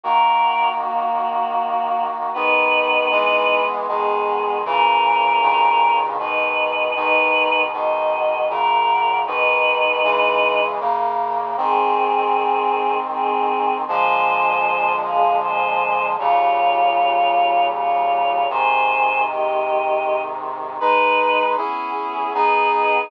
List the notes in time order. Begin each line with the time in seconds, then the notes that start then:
0.04 D#3 A#3 F#4 A#4 F#5
0.80 A#3 F#4
2.34 G#2 D#3 B3 D#4 B4
3.11 E3 G#3 B3
3.88 B2 D#3 G#3 B3 G#4
4.65 A#2 C#3 E3 C#4 A#4
5.42 G2 A#2 C#3 D#3
6.19 G#2 B2 D#3 D#4 B4
6.96 G#2 B2 D#3 D#4 B4
7.72 G#2 B2 D#3 F#4 D#5
8.50 F#2 A#2 C#3 A#4 F#5
9.26 G#2 B2 D#3 D#4 B4
10.04 C#3 E3 G#3
10.80 F#2 C#3 A#3
11.57 G#2 D#3 C4 G#4
13.11 C4 G#4
13.88 A#2 D3 F3 G#3 C5 G#5
15.03 G#4 F5
15.42 C5 G#5
16.19 D#2 A#2 C#3 G3 F4 C#5
17.73 F4 C#5
18.50 G#2 C3 D#3 C5 G#5
19.26 G4 D#5
20.80 G#3 D#4 B4
21.57 B3 C#4 E4 G#4
21.97 B3 G#4
22.34 B3 D#4 G#4 B4
22.72 D#4 B4